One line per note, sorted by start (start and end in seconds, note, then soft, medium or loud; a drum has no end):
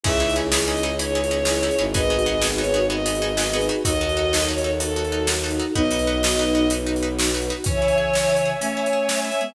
0.04 1.70 C#2 medium
0.04 1.93 C#4 medium
0.04 0.11 C#4 loud
0.04 1.93 D#4 medium
0.04 0.11 D#4 loud
0.04 0.84 E4 medium
0.04 1.93 E4 medium
0.04 0.11 E4 loud
0.04 0.84 G#4 loud
0.04 1.93 G#4 medium
0.04 0.11 G#4 loud
0.04 0.36 E5 loud
0.04 kick medium
0.04 crash medium
0.20 0.26 C#4 medium
0.20 0.26 D#4 medium
0.20 0.26 E4 medium
0.20 0.26 G#4 medium
0.29 closed hi-hat medium
0.36 0.42 C#4 medium
0.36 0.42 D#4 medium
0.36 0.42 E4 medium
0.36 0.42 G#4 loud
0.52 0.58 C#4 medium
0.52 0.58 D#4 medium
0.52 0.58 E4 loud
0.52 0.58 G#4 loud
0.52 snare loud
0.67 0.74 C#4 medium
0.67 0.74 D#4 loud
0.67 0.74 E4 medium
0.67 0.74 G#4 medium
0.67 0.95 D#5 loud
0.77 closed hi-hat medium
0.83 0.90 C#4 medium
0.83 0.90 D#4 loud
0.83 0.90 E4 medium
0.83 0.90 G#4 loud
0.99 1.06 C#4 medium
0.99 1.06 D#4 loud
0.99 1.06 E4 loud
0.99 1.06 G#4 medium
0.99 1.85 C#5 loud
0.99 closed hi-hat medium
1.15 1.21 C#4 medium
1.15 1.21 D#4 medium
1.15 1.21 E4 medium
1.15 1.21 G#4 loud
1.24 closed hi-hat medium
1.31 1.37 C#4 medium
1.31 1.37 D#4 medium
1.31 1.37 E4 medium
1.31 1.37 G#4 loud
1.45 1.53 C#4 medium
1.45 1.53 D#4 loud
1.45 1.53 E4 medium
1.45 1.90 E4 medium
1.45 1.53 G#4 medium
1.45 1.90 G#4 medium
1.45 snare medium
1.63 1.69 C#4 medium
1.63 1.69 D#4 loud
1.63 1.69 E4 loud
1.63 1.69 G#4 medium
1.71 closed hi-hat medium
1.79 3.70 G#1 medium
1.79 1.85 C#4 medium
1.79 1.85 D#4 medium
1.79 1.85 E4 medium
1.79 1.85 G#4 medium
1.94 2.01 B3 loud
1.94 3.83 B3 medium
1.94 2.01 D#4 loud
1.94 3.83 D#4 medium
1.94 2.01 F#4 loud
1.94 3.83 F#4 medium
1.94 2.01 G#4 loud
1.94 3.83 G#4 medium
1.94 2.83 G#4 loud
1.94 2.83 B4 loud
1.94 2.46 D#5 loud
1.94 kick medium
1.94 closed hi-hat medium
2.10 2.17 B3 medium
2.10 2.17 D#4 medium
2.10 2.17 F#4 medium
2.10 2.17 G#4 medium
2.19 closed hi-hat medium
2.26 2.33 B3 loud
2.26 2.33 D#4 medium
2.26 2.33 F#4 loud
2.26 2.33 G#4 medium
2.42 2.49 B3 medium
2.42 2.49 D#4 loud
2.42 2.49 F#4 loud
2.42 2.49 G#4 loud
2.42 snare medium
2.58 2.65 B3 loud
2.58 2.65 D#4 medium
2.58 2.65 F#4 medium
2.58 2.65 G#4 medium
2.58 2.86 C#5 loud
2.64 closed hi-hat medium
2.74 2.80 B3 loud
2.74 2.80 D#4 loud
2.74 2.80 F#4 medium
2.74 2.80 G#4 medium
2.90 2.96 B3 loud
2.90 2.96 D#4 loud
2.90 2.96 F#4 loud
2.90 2.96 G#4 medium
2.90 3.67 D#5 medium
3.06 3.12 B3 loud
3.06 3.12 D#4 loud
3.06 3.12 F#4 medium
3.06 3.12 G#4 medium
3.06 closed hi-hat medium
3.15 closed hi-hat medium
3.22 3.28 B3 medium
3.22 3.28 D#4 medium
3.22 3.28 F#4 medium
3.22 3.28 G#4 loud
3.37 3.44 B3 medium
3.37 3.44 D#4 medium
3.37 3.44 F#4 loud
3.37 3.44 G#4 loud
3.37 snare medium
3.53 3.60 B3 medium
3.53 3.60 D#4 medium
3.53 3.60 F#4 medium
3.53 3.82 G#4 medium
3.53 3.60 G#4 loud
3.53 3.82 B4 loud
3.61 closed hi-hat medium
3.69 3.75 B3 loud
3.69 3.75 D#4 medium
3.69 3.75 F#4 loud
3.69 3.75 G#4 medium
3.85 5.60 D#2 medium
3.85 4.32 D#4 medium
3.85 3.91 D#4 loud
3.85 5.74 D#4 medium
3.85 4.32 F#4 loud
3.85 3.91 F#4 loud
3.85 5.74 F#4 medium
3.85 3.91 A4 loud
3.85 5.74 A4 medium
3.85 4.47 D#5 loud
3.85 kick medium
3.85 closed hi-hat loud
4.01 4.07 D#4 medium
4.01 4.07 F#4 loud
4.01 4.07 A4 medium
4.09 closed hi-hat medium
4.17 4.23 D#4 medium
4.17 4.23 F#4 medium
4.17 4.23 A4 medium
4.33 4.39 D#4 medium
4.33 4.39 F#4 medium
4.33 4.39 A4 loud
4.33 snare medium
4.48 4.55 D#4 medium
4.48 4.55 F#4 medium
4.48 4.55 A4 medium
4.48 4.75 C#5 medium
4.58 closed hi-hat medium
4.64 4.71 D#4 medium
4.64 4.71 F#4 medium
4.64 4.71 A4 medium
4.80 4.86 D#4 medium
4.80 4.86 F#4 medium
4.80 4.86 A4 medium
4.80 5.28 A4 medium
4.80 closed hi-hat medium
4.96 5.03 D#4 medium
4.96 5.03 F#4 medium
4.96 5.03 A4 medium
5.04 closed hi-hat soft
5.12 5.19 D#4 medium
5.12 5.19 F#4 medium
5.12 5.19 A4 medium
5.27 5.34 D#4 loud
5.27 5.73 D#4 medium
5.27 5.34 F#4 medium
5.27 5.73 F#4 loud
5.27 5.34 A4 loud
5.27 snare medium
5.44 5.50 D#4 medium
5.44 5.50 F#4 medium
5.44 5.50 A4 medium
5.51 closed hi-hat medium
5.60 5.66 D#4 medium
5.60 5.66 F#4 medium
5.60 5.66 A4 medium
5.74 7.51 B1 medium
5.74 7.29 B3 loud
5.74 7.29 D#4 loud
5.74 5.82 D#4 loud
5.74 7.64 D#4 medium
5.74 5.82 F#4 loud
5.74 7.64 F#4 medium
5.74 5.82 B4 loud
5.74 7.64 B4 medium
5.74 6.71 D#5 loud
5.74 kick medium
5.91 5.98 D#4 medium
5.91 5.98 F#4 medium
5.91 5.98 B4 medium
5.91 closed hi-hat medium
5.99 closed hi-hat medium
6.07 6.14 D#4 loud
6.07 6.14 F#4 medium
6.07 6.14 B4 loud
6.23 6.29 D#4 medium
6.23 6.29 F#4 medium
6.23 6.29 B4 medium
6.23 snare loud
6.39 6.45 D#4 medium
6.39 6.45 F#4 loud
6.39 6.45 B4 medium
6.55 6.61 D#4 medium
6.55 6.61 F#4 medium
6.55 6.61 B4 medium
6.70 6.77 D#4 medium
6.70 6.77 F#4 loud
6.70 6.77 B4 medium
6.70 closed hi-hat medium
6.86 6.93 D#4 medium
6.86 6.93 F#4 medium
6.86 6.93 B4 medium
6.96 closed hi-hat medium
7.03 7.09 D#4 medium
7.03 7.09 F#4 medium
7.03 7.09 B4 medium
7.19 7.25 D#4 medium
7.19 7.25 F#4 medium
7.19 7.25 B4 medium
7.19 snare loud
7.34 7.41 D#4 medium
7.34 7.41 F#4 medium
7.34 7.41 B4 loud
7.41 closed hi-hat medium
7.50 7.56 D#4 medium
7.50 7.56 F#4 loud
7.50 7.56 B4 loud
7.64 8.54 C#3 medium
7.64 8.54 E3 loud
7.64 7.80 C#4 loud
7.64 9.54 C#5 loud
7.64 8.50 C#5 loud
7.64 9.54 E5 loud
7.64 9.54 G#5 medium
7.64 kick medium
7.64 closed hi-hat medium
7.82 7.96 E4 medium
7.88 closed hi-hat medium
7.98 8.12 G#4 medium
8.14 8.28 C#4 medium
8.14 snare medium
8.29 8.44 E4 medium
8.37 closed hi-hat medium
8.46 8.60 G#4 medium
8.60 9.30 A3 medium
8.60 9.30 C#4 medium
8.60 8.76 C#4 medium
8.60 9.22 C#5 medium
8.60 closed hi-hat medium
8.77 8.91 E4 medium
8.86 closed hi-hat medium
8.93 9.07 G#4 medium
9.09 9.23 C#4 medium
9.09 snare medium
9.24 9.39 E4 medium
9.24 9.50 E5 loud
9.31 closed hi-hat medium
9.40 9.53 G#3 medium
9.40 9.53 B3 medium
9.40 9.54 G#4 medium